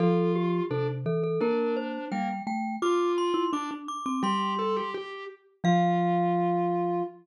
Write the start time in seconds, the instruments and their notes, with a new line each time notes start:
0.00 marimba F3, vibraphone F4, glockenspiel A4
0.35 glockenspiel G4
0.70 marimba C3, vibraphone D4, glockenspiel A4
1.06 marimba E3, glockenspiel A4
1.24 glockenspiel A4
1.41 marimba A#3, vibraphone D4, glockenspiel A#4
1.77 glockenspiel C5
2.11 marimba G3, vibraphone A#3, glockenspiel G5
2.47 marimba A3, glockenspiel G5
2.82 marimba F4, vibraphone F4, glockenspiel D6
3.18 glockenspiel C6
3.34 marimba E4
3.53 marimba D4, vibraphone D4, glockenspiel D6
3.71 marimba D4
3.88 glockenspiel D6
4.06 marimba C4, glockenspiel D6
4.23 marimba G3, vibraphone G4, glockenspiel C6
4.59 vibraphone A4
4.76 vibraphone G4
4.94 vibraphone G4
5.64 marimba F3, vibraphone F4, glockenspiel F5